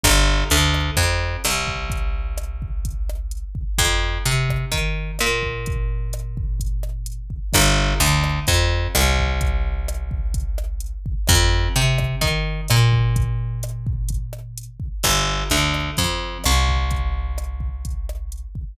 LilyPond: <<
  \new Staff \with { instrumentName = "Electric Bass (finger)" } { \clef bass \time 4/4 \key g \minor \tempo 4 = 128 g,,4 d,4 f,4 c,4~ | c,1 | f,4 c4 ees4 bes,4~ | bes,1 |
g,,4 d,4 f,4 c,4~ | c,1 | f,4 c4 ees4 bes,4~ | bes,1 |
g,,4 d,4 f,4 c,4~ | c,1 | }
  \new DrumStaff \with { instrumentName = "Drums" } \drummode { \time 4/4 <hh bd ss>4 hh8 ss8 <hh bd>4 <hh ss>8 bd8 | <hh bd>4 <hh ss>8 bd8 <hh bd>8 ss8 hh8 bd8 | <hh bd ss>4 hh8 <bd ss>8 <hh bd>4 <hh ss>8 bd8 | <hh bd>4 <hh ss>8 bd8 <hh bd>8 ss8 hh8 bd8 |
<hh bd ss>4 hh8 ss8 <hh bd>4 <hh ss>8 bd8 | <hh bd>4 <hh ss>8 bd8 <hh bd>8 ss8 hh8 bd8 | <hh bd ss>4 hh8 <bd ss>8 <hh bd>4 <hh ss>8 bd8 | <hh bd>4 <hh ss>8 bd8 <hh bd>8 ss8 hh8 bd8 |
<hh bd ss>4 hh8 ss8 <hh bd>4 <hh ss>8 bd8 | <hh bd>4 <hh ss>8 bd8 <hh bd>8 ss8 hh8 bd8 | }
>>